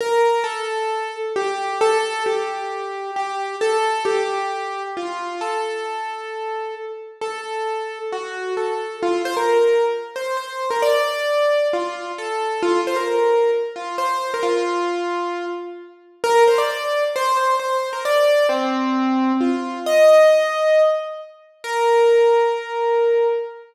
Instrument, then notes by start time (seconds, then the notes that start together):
acoustic grand piano
0.01 A#4
0.44 A4
1.36 G4
1.81 A4
2.26 G4
3.16 G4
3.61 A4
4.05 G4
4.97 F4
5.41 A4
7.21 A4
8.12 F#4
8.57 A4
9.03 F4
9.25 C5
9.37 A#4
10.16 C5
10.37 C5
10.70 A#4
10.82 D5
11.73 F4
12.18 A4
12.63 F4
12.87 C5
12.96 A#4
13.76 F4
13.98 C5
14.34 A#4
14.43 F4
16.24 A#4
16.47 C5
16.58 D5
17.16 C5
17.37 C5
17.59 C5
17.93 A#4
18.05 D5
18.49 C4
19.41 F4
19.86 D#5
21.64 A#4